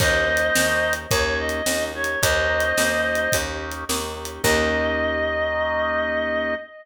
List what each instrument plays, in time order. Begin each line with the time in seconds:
0.00 electric bass (finger) D#2, drawbar organ A#3 C#4 D#4 G4, clarinet C5 D#5, kick, crash
0.28 drawbar organ A#3 C#4 D#4 G4
0.37 closed hi-hat
0.55 electric bass (finger) D#2, drawbar organ A#3 C#4 D#4 G4, snare
0.93 closed hi-hat
1.11 electric bass (finger) D#2, drawbar organ A#3 C#4 D#4 G4, clarinet C#5, kick, closed hi-hat
1.39 clarinet D#5
1.49 closed hi-hat
1.66 electric bass (finger) D#2, drawbar organ A#3 C#4 D#4 G4, snare
1.95 drawbar organ A#3 C#4 D#4 G4, clarinet C#5
2.04 closed hi-hat
2.22 electric bass (finger) D#2, drawbar organ A#3 C#4 D#4 G4, clarinet C5 D#5, kick, closed hi-hat
2.49 drawbar organ A#3 C#4 D#4 G4
2.60 closed hi-hat
2.77 electric bass (finger) D#2, drawbar organ A#3 C#4 D#4 G4, snare
3.15 closed hi-hat
3.32 electric bass (finger) D#2, drawbar organ A#3 C#4 D#4 G4, kick, closed hi-hat
3.71 closed hi-hat
3.89 electric bass (finger) D#2, drawbar organ A#3 C#4 D#4 G4, snare
4.16 drawbar organ A#3 C#4 D#4 G4
4.25 closed hi-hat
4.43 electric bass (finger) D#2, drawbar organ A#3 C#4 D#4 G4, clarinet D#5, kick, crash